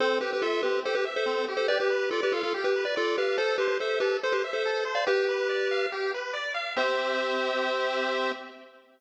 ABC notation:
X:1
M:4/4
L:1/16
Q:1/4=142
K:C
V:1 name="Lead 1 (square)"
[Ac]2 [GB] [GB] [FA]2 [GB]2 [Ac] [GB] z [Ac]3 z [Ac] | [Bd] [GB]3 [FA] [GB] [FA] [FA] z [GB]2 [Bd] [FA]2 [GB]2 | [Ac]2 [GB] [GB] [Ac]2 [GB]2 [Ac] [GB] z [Ac]3 z [df] | [GB]8 z8 |
c16 |]
V:2 name="Lead 1 (square)"
C2 G2 e2 C2 G2 e2 C2 G2 | G2 B2 d2 f2 G2 B2 d2 f2 | A2 c2 e2 A2 c2 e2 A2 c2 | G2 B2 d2 f2 G2 B2 d2 f2 |
[CGe]16 |]